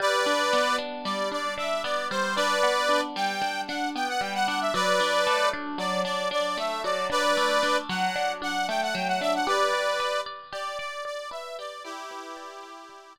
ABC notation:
X:1
M:9/8
L:1/16
Q:3/8=76
K:G
V:1 name="Accordion"
[Bd]6 z2 d2 d2 e2 d2 c2 | [Bd]6 g4 f2 g f g f f e | [Bd]6 z2 d2 d2 d2 e2 d2 | [Bd]6 f4 f2 g f g f e f |
[Bd]6 z2 d2 d2 d2 e2 d2 | [EG]12 z6 |]
V:2 name="Acoustic Guitar (steel)"
G,2 D2 B,2 D2 G,2 D2 D2 B,2 G,2 | D2 B,2 D2 G,2 D2 D2 B,2 G,2 D2 | F,2 D2 A,2 D2 F,2 D2 D2 A,2 F,2 | D2 A,2 D2 F,2 D2 D2 A,2 F,2 D2 |
G2 d2 B2 d2 G2 d2 d2 B2 G2 | d2 B2 d2 G2 d2 d2 z6 |]